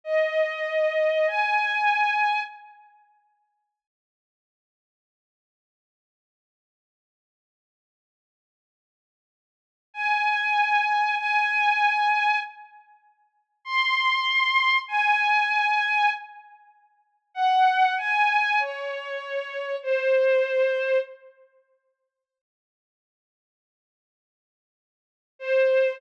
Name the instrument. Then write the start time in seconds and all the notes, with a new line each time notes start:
violin
0.04 D#5
1.27 G#5
9.94 G#5
11.17 G#5
13.65 C6
14.88 G#5
17.34 F#5
17.97 G#5
18.59 C#5
19.82 C5
25.39 C5